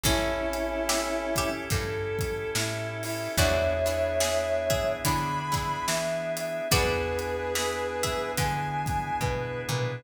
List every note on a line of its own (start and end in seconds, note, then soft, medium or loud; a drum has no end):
0.03 1.49 A1 medium
0.03 0.75 C#4 loud
0.03 3.36 C#4 loud
0.03 1.49 C#4 loud
0.03 3.36 E4 medium
0.03 1.49 E4 loud
0.03 3.36 G4 medium
0.03 0.75 A4 loud
0.03 3.36 A4 loud
0.03 kick loud
0.03 closed hi-hat medium
0.53 closed hi-hat medium
0.89 1.33 G4 medium
0.89 1.33 E5 loud
0.89 snare loud
1.36 1.71 G4 loud
1.36 1.71 E5 loud
1.36 kick medium
1.36 closed hi-hat medium
1.70 2.44 G2 medium
1.70 2.50 A4 loud
1.70 kick loud
1.70 closed hi-hat medium
2.19 kick medium
2.19 closed hi-hat medium
2.55 3.28 A2 medium
2.55 3.00 E4 medium
2.55 snare loud
3.03 3.32 E4 loud
3.03 open hi-hat medium
3.37 4.83 E2 loud
3.37 6.68 B3 medium
3.37 3.73 B3 loud
3.37 6.68 D4 medium
3.37 3.73 D4 loud
3.37 6.68 E4 loud
3.37 3.73 E4 medium
3.37 4.14 F#4 loud
3.37 6.68 G#4 loud
3.37 3.73 G#4 loud
3.37 4.93 C#5 loud
3.37 4.14 D5 loud
3.37 4.93 E5 loud
3.37 kick loud
3.37 closed hi-hat medium
3.86 4.40 B3 medium
3.86 4.40 D4 loud
3.86 4.40 E4 loud
3.86 4.40 G#4 medium
3.86 closed hi-hat medium
4.20 4.61 G#4 medium
4.20 4.61 E5 loud
4.20 snare loud
4.70 5.03 G#4 medium
4.70 5.03 E5 medium
4.70 kick medium
4.70 closed hi-hat medium
5.05 5.77 D3 medium
5.05 5.39 B3 medium
5.05 5.39 D4 medium
5.05 5.39 E4 loud
5.05 5.39 G#4 medium
5.05 5.85 B5 loud
5.05 kick medium
5.05 closed hi-hat loud
5.52 6.06 B3 medium
5.52 6.06 D4 loud
5.52 6.06 E4 loud
5.52 6.06 G#4 loud
5.52 kick medium
5.52 closed hi-hat medium
5.87 6.61 E3 medium
5.87 6.31 E5 loud
5.87 snare loud
6.36 6.66 E5 loud
6.36 closed hi-hat medium
6.71 8.18 E2 medium
6.71 10.01 B3 loud
6.71 7.34 B3 loud
6.71 10.01 D4 medium
6.71 7.34 D4 loud
6.71 10.01 E4 loud
6.71 7.34 E4 loud
6.71 7.53 F#4 loud
6.71 10.01 G#4 medium
6.71 7.34 G#4 loud
6.71 8.32 G#4 loud
6.71 8.32 B4 loud
6.71 7.53 D5 loud
6.71 kick loud
6.71 closed hi-hat loud
7.19 closed hi-hat medium
7.55 7.94 G#4 medium
7.55 7.94 E5 medium
7.55 snare loud
8.03 8.33 G#4 medium
8.03 8.33 E5 medium
8.03 kick medium
8.03 closed hi-hat medium
8.37 9.11 D3 medium
8.37 9.19 G#5 loud
8.37 kick medium
8.37 closed hi-hat medium
8.86 kick medium
8.86 closed hi-hat medium
9.21 9.64 B2 medium
9.21 9.62 B4 loud
9.21 kick medium
9.69 10.00 A#2 medium
9.69 10.02 B4 loud
9.69 mid tom medium